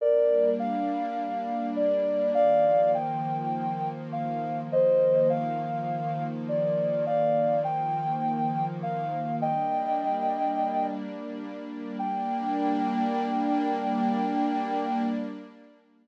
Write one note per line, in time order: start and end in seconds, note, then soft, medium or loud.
0.00 2.33 G3 medium
0.00 2.33 A#3 medium
0.00 2.33 D4 medium
0.00 0.50 A#4 loud
0.00 0.50 D5 loud
0.59 1.66 F5 loud
1.76 2.31 D5 loud
2.35 4.68 D#3 medium
2.35 4.68 F3 medium
2.35 4.68 A#3 medium
2.35 2.91 D5 loud
2.35 2.91 F5 loud
2.94 3.89 G5 loud
4.12 4.61 F5 loud
4.71 7.04 D#3 medium
4.71 7.04 F3 medium
4.71 7.04 A#3 medium
4.71 5.28 C5 loud
4.71 5.28 D#5 loud
5.30 6.24 F5 loud
6.49 7.05 D5 medium
7.06 9.39 D#3 medium
7.06 9.39 F3 medium
7.06 9.39 A#3 medium
7.06 7.59 D5 loud
7.06 7.59 F5 loud
7.64 8.66 G5 loud
8.83 9.36 F5 loud
9.41 11.96 G3 medium
9.41 11.96 A#3 medium
9.41 11.96 D4 medium
9.41 10.87 D#5 loud
9.41 10.87 G5 loud
11.99 15.03 G3 medium
11.99 15.03 A#3 loud
11.99 15.03 D4 loud
11.99 15.02 G5 loud